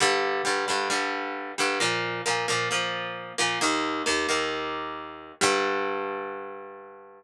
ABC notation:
X:1
M:4/4
L:1/8
Q:1/4=133
K:Gm
V:1 name="Acoustic Guitar (steel)"
[G,,D,G,]2 [G,,D,G,] [G,,D,G,] [G,,D,G,]3 [G,,D,G,] | [B,,F,B,]2 [B,,F,B,] [B,,F,B,] [B,,F,B,]3 [B,,F,B,] | [E,,E,B,]2 [E,,E,B,] [E,,E,B,]5 | [G,,D,G,]8 |]